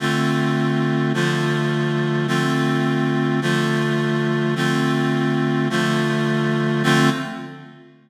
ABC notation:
X:1
M:3/4
L:1/8
Q:1/4=79
K:Dm
V:1 name="Clarinet"
[D,A,CF]3 [D,F,A,F]3 | [D,A,CF]3 [D,F,A,F]3 | [D,A,CF]3 [D,F,A,F]3 | [D,A,CF]2 z4 |]